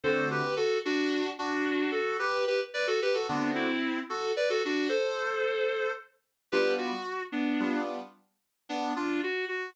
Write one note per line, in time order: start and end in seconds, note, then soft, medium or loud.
0.03 0.42 D3 medium
0.03 0.42 A3 medium
0.03 0.42 C4 medium
0.03 0.42 F#4 medium
0.03 0.28 A4 medium
0.03 0.28 C5 loud
0.31 0.55 G4 medium
0.31 0.55 B4 medium
0.56 0.78 F#4 medium
0.56 0.78 A4 medium
0.85 1.30 D4 medium
0.85 1.30 F#4 loud
1.39 1.92 D4 medium
1.39 1.91 F#4 loud
1.91 2.17 F#4 medium
1.91 2.17 A4 medium
2.19 2.45 G4 medium
2.19 2.45 B4 loud
2.47 2.60 G4 medium
2.47 2.60 B4 medium
2.74 2.87 B4 medium
2.74 2.87 D5 medium
2.87 3.00 F#4 medium
2.87 3.00 A4 medium
3.02 3.15 G4 medium
3.02 3.15 B4 loud
3.14 3.27 F#4 medium
3.14 3.27 A4 medium
3.28 3.67 D3 medium
3.28 3.67 A3 medium
3.28 3.51 B3 medium
3.28 3.67 C4 medium
3.28 3.51 D4 medium
3.28 3.67 F#4 medium
3.55 4.00 C4 medium
3.55 4.00 E4 medium
4.09 4.32 F#4 medium
4.09 4.32 A4 medium
4.36 4.49 B4 medium
4.36 4.49 D5 medium
4.50 4.62 F#4 medium
4.50 4.62 A4 loud
4.65 4.88 D4 medium
4.65 4.88 F#4 medium
4.89 5.91 A4 medium
4.89 5.91 C5 medium
6.52 6.91 G3 medium
6.52 6.91 B3 medium
6.52 6.91 D4 medium
6.52 6.91 F4 medium
6.52 6.74 G4 medium
6.52 6.74 B4 loud
6.78 7.23 F#4 medium
7.32 7.81 B3 medium
7.32 7.81 D4 medium
7.60 7.98 G3 medium
7.60 7.98 B3 medium
7.60 7.98 D4 medium
7.60 7.98 F4 medium
8.69 8.93 B3 medium
8.69 8.93 D4 medium
8.96 9.21 D4 medium
8.96 9.21 F4 medium
9.23 9.45 F#4 medium
9.48 9.70 F#4 medium